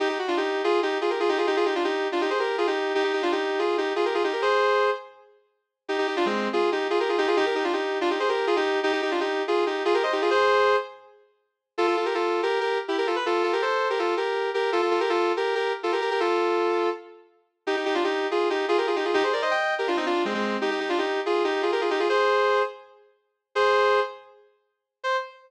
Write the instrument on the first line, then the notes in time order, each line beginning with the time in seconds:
distortion guitar
0.00 D#4 G4
0.09 D#4 G4
0.19 F#4
0.28 D4 F4
0.37 D#4 G4
0.64 F4 G#4
0.82 D#4 G4
1.01 F4 G#4
1.10 G4 A#4
1.20 F4 G#4
1.29 D#4 G4
1.38 F4 G#4
1.47 D#4 G4
1.56 F4 G#4
1.65 D#4 G4
1.75 D4 F4
1.84 D#4 G4
2.12 D4 F4
2.21 D#4 G4
2.30 G#4 C5
2.39 G4 A#4
2.58 F4 G#4
2.67 D#4 G4
2.95 D#4 G4
3.04 D#4 G4
3.13 D#4 G4
3.22 D4 F4
3.32 D#4 G4
3.59 F4 G#4
3.78 D#4 G4
3.96 F4 G#4
4.05 G4 A#4
4.14 F4 G#4
4.24 D#4 G4
4.33 G4 A#4
4.42 G#4 C5
5.88 D#4 G4
5.98 D#4 G4
6.07 D#4 G4
6.16 D4 F4
6.26 G#3 C4
6.53 F4 G#4
6.72 D#4 G4
6.90 F4 G#4
7.00 G4 A#4
7.09 F4 G#4
7.18 D#4 G4
7.27 F4 G#4
7.37 D#4 G4
7.46 G4 A#4
7.55 D#4 G4
7.64 D4 F4
7.73 D#4 G4
8.01 D4 F4
8.10 D#4 G4
8.20 G#4 C5
8.29 G4 A#4
8.47 F4 G#4
8.56 D#4 G4
8.83 D#4 G4
8.92 D#4 G4
9.02 D#4 G4
9.11 D4 F4
9.20 D#4 G4
9.48 F4 G#4
9.66 D#4 G4
9.85 F4 G#4
9.94 G4 A#4
10.03 C5 D#5
10.12 D#4 G4
10.21 F4 G#4
10.31 G#4 C5
11.78 F4 A4
11.87 F4 A4
11.96 F4 A4
12.05 G4 A#4
12.14 F4 A4
12.43 G4 A#4
12.61 G4 A#4
12.88 E4 G4
12.98 G4 A#4
13.07 F4 A4
13.16 B4
13.26 F4 A4
13.43 F4 A4
13.53 G4 A#4
13.62 A4 C5
13.90 G4 A#4
13.99 F4 A4
14.17 G4 A#4
14.54 G4 A#4
14.72 F4 A4
14.82 F4 A4
14.91 F4 A4
15.00 G4 A#4
15.09 F4 A4
15.37 G4 A#4
15.55 G4 A#4
15.83 F4 A4
15.92 G4 A#4
16.01 G4 A#4
16.11 G4 A#4
16.20 F4 A4
17.67 D#4 G4
17.76 D#4 G4
17.85 D#4 G4
17.94 D4 F4
18.04 D#4 G4
18.31 F4 G#4
18.50 D#4 G4
18.68 F4 G#4
18.78 G4 A#4
18.87 F4 G#4
18.96 D#4 G4
19.05 F4 G#4
19.14 D#4 G4
19.23 G#4 C5
19.33 A#4 D5
19.42 C5 D#5
19.51 D#5 G5
19.78 G4 A#4
19.87 D4 F4
19.97 C4 D#4
20.06 D4 F4
20.25 G#3 C4
20.34 G#3 C4
20.61 D#4 G4
20.71 D#4 G4
20.80 D#4 G4
20.89 D4 F4
20.98 D#4 G4
21.26 F4 G#4
21.44 D#4 G4
21.62 F4 G#4
21.72 G4 A#4
21.81 F4 G#4
21.90 D#4 G4
21.99 F4 G#4
22.09 G#4 C5
23.55 G#4 C5
25.04 C5